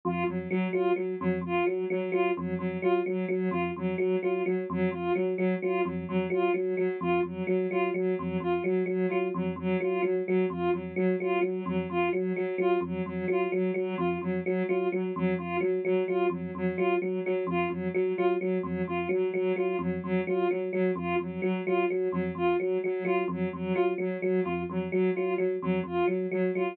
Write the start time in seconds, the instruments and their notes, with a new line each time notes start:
0.05 electric piano 1 F2, ocarina F4
0.27 electric piano 1 F2, ocarina F#3
0.49 ocarina F#3, electric piano 1 F#3
0.73 electric piano 1 F#3, ocarina F4
0.96 ocarina F#3, electric piano 1 F#3
1.20 electric piano 1 F2, ocarina F#3
1.41 electric piano 1 F2, ocarina F4
1.66 ocarina F#3, electric piano 1 F#3
1.90 electric piano 1 F#3, ocarina F#3
2.12 electric piano 1 F#3, ocarina F4
2.35 electric piano 1 F2, ocarina F#3
2.58 electric piano 1 F2, ocarina F#3
2.82 electric piano 1 F#3, ocarina F4
3.06 electric piano 1 F#3, ocarina F#3
3.28 electric piano 1 F#3, ocarina F#3
3.51 electric piano 1 F2, ocarina F4
3.76 electric piano 1 F2, ocarina F#3
3.97 ocarina F#3, electric piano 1 F#3
4.23 electric piano 1 F#3, ocarina F4
4.46 ocarina F#3, electric piano 1 F#3
4.70 electric piano 1 F2, ocarina F#3
4.91 electric piano 1 F2, ocarina F4
5.14 ocarina F#3, electric piano 1 F#3
5.36 ocarina F#3, electric piano 1 F#3
5.62 electric piano 1 F#3, ocarina F4
5.85 electric piano 1 F2, ocarina F#3
6.08 electric piano 1 F2, ocarina F#3
6.30 electric piano 1 F#3, ocarina F4
6.54 electric piano 1 F#3, ocarina F#3
6.77 electric piano 1 F#3, ocarina F#3
7.01 electric piano 1 F2, ocarina F4
7.23 electric piano 1 F2, ocarina F#3
7.47 electric piano 1 F#3, ocarina F#3
7.71 electric piano 1 F#3, ocarina F4
7.94 electric piano 1 F#3, ocarina F#3
8.18 electric piano 1 F2, ocarina F#3
8.40 electric piano 1 F2, ocarina F4
8.64 electric piano 1 F#3, ocarina F#3
8.86 electric piano 1 F#3, ocarina F#3
9.08 electric piano 1 F#3, ocarina F4
9.34 electric piano 1 F2, ocarina F#3
9.56 electric piano 1 F2, ocarina F#3
9.80 electric piano 1 F#3, ocarina F4
10.03 electric piano 1 F#3, ocarina F#3
10.26 ocarina F#3, electric piano 1 F#3
10.50 electric piano 1 F2, ocarina F4
10.73 electric piano 1 F2, ocarina F#3
10.96 electric piano 1 F#3, ocarina F#3
11.20 electric piano 1 F#3, ocarina F4
11.41 electric piano 1 F#3, ocarina F#3
11.66 electric piano 1 F2, ocarina F#3
11.90 electric piano 1 F2, ocarina F4
12.13 electric piano 1 F#3, ocarina F#3
12.36 ocarina F#3, electric piano 1 F#3
12.58 electric piano 1 F#3, ocarina F4
12.81 electric piano 1 F2, ocarina F#3
13.06 electric piano 1 F2, ocarina F#3
13.28 electric piano 1 F#3, ocarina F4
13.52 electric piano 1 F#3, ocarina F#3
13.74 electric piano 1 F#3, ocarina F#3
13.98 electric piano 1 F2, ocarina F4
14.21 electric piano 1 F2, ocarina F#3
14.44 ocarina F#3, electric piano 1 F#3
14.68 electric piano 1 F#3, ocarina F4
14.92 electric piano 1 F#3, ocarina F#3
15.16 electric piano 1 F2, ocarina F#3
15.38 electric piano 1 F2, ocarina F4
15.61 electric piano 1 F#3, ocarina F#3
15.85 electric piano 1 F#3, ocarina F#3
16.07 electric piano 1 F#3, ocarina F4
16.30 electric piano 1 F2, ocarina F#3
16.55 electric piano 1 F2, ocarina F#3
16.76 electric piano 1 F#3, ocarina F4
17.00 ocarina F#3, electric piano 1 F#3
17.25 ocarina F#3, electric piano 1 F#3
17.47 electric piano 1 F2, ocarina F4
17.69 electric piano 1 F2, ocarina F#3
17.94 ocarina F#3, electric piano 1 F#3
18.17 electric piano 1 F#3, ocarina F4
18.39 ocarina F#3, electric piano 1 F#3
18.63 electric piano 1 F2, ocarina F#3
18.87 electric piano 1 F2, ocarina F4
19.09 electric piano 1 F#3, ocarina F#3
19.34 electric piano 1 F#3, ocarina F#3
19.56 electric piano 1 F#3, ocarina F4
19.79 electric piano 1 F2, ocarina F#3
20.02 electric piano 1 F2, ocarina F#3
20.27 electric piano 1 F#3, ocarina F4
20.50 ocarina F#3, electric piano 1 F#3
20.72 ocarina F#3, electric piano 1 F#3
20.96 electric piano 1 F2, ocarina F4
21.19 electric piano 1 F2, ocarina F#3
21.42 electric piano 1 F#3, ocarina F#3
21.66 electric piano 1 F#3, ocarina F4
21.89 ocarina F#3, electric piano 1 F#3
22.12 electric piano 1 F2, ocarina F#3
22.35 electric piano 1 F2, ocarina F4
22.59 ocarina F#3, electric piano 1 F#3
22.84 electric piano 1 F#3, ocarina F#3
23.05 electric piano 1 F#3, ocarina F4
23.28 electric piano 1 F2, ocarina F#3
23.53 electric piano 1 F2, ocarina F#3
23.74 electric piano 1 F#3, ocarina F4
23.98 electric piano 1 F#3, ocarina F#3
24.21 ocarina F#3, electric piano 1 F#3
24.43 electric piano 1 F2, ocarina F4
24.69 electric piano 1 F2, ocarina F#3
24.91 ocarina F#3, electric piano 1 F#3
25.14 electric piano 1 F#3, ocarina F4
25.37 ocarina F#3, electric piano 1 F#3
25.61 electric piano 1 F2, ocarina F#3
25.84 electric piano 1 F2, ocarina F4
26.07 electric piano 1 F#3, ocarina F#3
26.31 electric piano 1 F#3, ocarina F#3
26.54 electric piano 1 F#3, ocarina F4